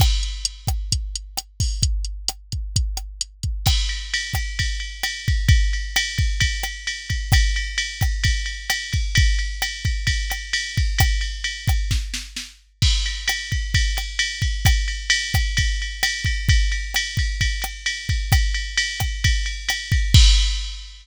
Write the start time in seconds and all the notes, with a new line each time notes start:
0.00 kick, cross-stick, crash
0.23 closed hi-hat
0.45 closed hi-hat
0.67 kick, cross-stick, closed hi-hat
0.92 kick, closed hi-hat
1.16 closed hi-hat
1.37 cross-stick, closed hi-hat
1.60 kick, open hi-hat
1.83 kick, closed hi-hat
2.05 closed hi-hat
2.28 cross-stick, closed hi-hat
2.52 kick, closed hi-hat
2.76 kick, closed hi-hat
2.97 cross-stick, closed hi-hat
3.21 closed hi-hat
3.43 kick, closed hi-hat
3.66 kick, cross-stick, crash
3.89 ride
4.14 ride
4.34 kick, cross-stick, ride
4.59 kick, ride
4.80 ride
5.03 cross-stick, ride
5.28 kick, ride
5.48 kick, ride
5.73 ride
5.96 cross-stick, ride
6.18 kick, ride
6.40 kick, ride
6.63 cross-stick, ride
6.87 ride
7.10 kick, ride
7.32 kick, cross-stick, ride
7.56 ride
7.78 ride
8.01 kick, cross-stick, ride
8.24 kick, ride
8.46 ride
8.70 cross-stick, ride
8.93 kick, ride
9.15 kick, ride
9.39 ride
9.62 cross-stick, ride
9.85 kick, ride
10.07 kick, ride
10.30 cross-stick, ride
10.53 ride
10.77 kick, ride
10.98 kick, cross-stick, ride
11.21 ride
11.44 ride
11.68 kick, cross-stick, ride
11.91 kick, snare
12.14 snare
12.36 snare
12.82 kick, crash
13.06 ride
13.28 cross-stick, ride
13.52 kick, ride
13.74 kick, ride
13.97 cross-stick, ride
14.19 ride
14.42 kick, ride
14.65 kick, cross-stick, ride
14.88 ride
15.10 ride
15.34 kick, cross-stick, ride
15.57 kick, ride
15.82 ride
16.03 cross-stick, ride
16.25 kick, ride
16.49 kick, ride
16.72 ride
16.94 cross-stick, ride
17.17 kick, ride
17.41 kick, ride
17.62 cross-stick, ride
17.86 ride
18.09 kick, ride
18.32 kick, cross-stick, ride
18.54 ride
18.77 ride
19.00 kick, cross-stick, ride
19.24 kick, ride
19.46 ride
19.69 cross-stick, ride
19.92 kick, ride
20.14 kick, crash